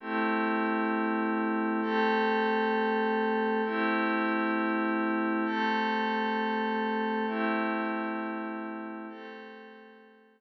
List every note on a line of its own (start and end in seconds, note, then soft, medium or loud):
0.00 1.80 A3 medium
0.00 1.80 C4 medium
0.00 1.80 E4 medium
0.00 1.80 G4 medium
1.82 3.62 A3 medium
1.82 3.62 C4 medium
1.82 3.62 G4 medium
1.82 3.62 A4 medium
3.65 5.45 A3 medium
3.65 5.45 C4 medium
3.65 5.45 E4 medium
3.65 5.45 G4 medium
5.45 7.25 A3 medium
5.45 7.25 C4 medium
5.45 7.25 G4 medium
5.45 7.25 A4 medium
7.27 9.07 A3 medium
7.27 9.07 C4 medium
7.27 9.07 E4 medium
7.27 9.07 G4 medium
9.09 10.41 A3 medium
9.09 10.41 C4 medium
9.09 10.41 G4 medium
9.09 10.41 A4 medium